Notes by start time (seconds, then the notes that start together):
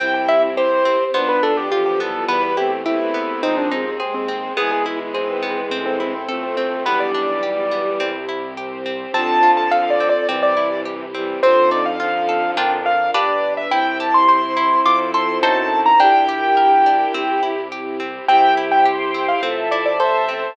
0.00 C2 C4 E4 G4 G5
0.14 G5
0.28 E4 E5
0.57 C4 G4 C5
0.85 C4
1.13 B1 B3 D4 F4 C5
1.29 B4
1.43 D4 A4
1.57 G4
1.71 D3 F3 B3 F4 G4
1.86 G4
2.00 E3 G3 B3 A4
2.28 E2 G3 B3 E4 G4 B4
2.43 B4
2.57 A3 C4 E4 G4
2.85 A3 B3 C4 E4 G4 B4
3.00 A3 C4
3.14 B3
3.43 D#2 F3 G#3 C4 D#4 G#4
3.57 D4
3.71 C4 D#4
3.86 C4
4.00 G#3 C4 G#4
4.14 C4
4.28 C4
4.57 G#1 E3 G#3 B3 E4 G#4
4.71 G#4
4.86 E4
5.14 B3 C4 G#4 B4
5.43 B3
5.70 A1 C4 E4 A4
5.86 C4
6.00 C4 E4
6.14 C4
6.28 F3 A3 C4 A4
6.43 C4
6.57 C4
6.84 B1 E3 G3 B3 D4 G4 B4
7.00 D5
7.14 D4
7.42 G3 B3 G4
7.71 B3
8.00 C2 C4 E4 G4
8.29 E4
8.57 C4 G4 C5
8.86 C4
9.13 F2 D3 F3 C4 F4 A4 A5
9.43 F4
9.57 A5
9.71 A4 F5
9.90 D5
10.00 C4
10.09 D5
10.28 C2 C3 E3 C4 E4 G4 D5
10.43 D5
10.57 E4
10.85 G4
11.14 E3 G3 C4
11.42 F2 D3 F3 C4 D#4 F4 A4 C5
11.71 D#4 D5
11.86 F5
12.00 D3 F3 F4 F5
12.29 A4
12.57 F2 D4 F4 A#4 G5
12.86 F5
13.14 G1 D4 G4 B4 D5
13.57 E5
13.71 C2 C4 E4 G4 C5 G5
14.00 G4 A5
14.14 C6
14.29 C5 C6
14.57 E4
14.85 F2 F4 A4 C5 D6
15.14 A4 C6
15.41 F#2 D#4 F#4 A4 C5 A5
15.86 A#5
16.00 A#1 D4 E4 G4 A#4 G5
16.29 G4
16.57 A#4
16.86 D4
17.14 C2 C4 E4 G4
17.43 E4
17.72 G4
18.00 C4
18.28 C2 C4 E4 G4 C5 E5 G5
18.57 E4
18.72 G5
18.85 G4 C5 G5 C6
19.14 C4
19.28 F5
19.41 A1 C4 F4 A4 C5 E5 A5
19.71 E4 D5
19.85 D5
19.99 A4 C5 E5 A5
20.29 C4 C5 E5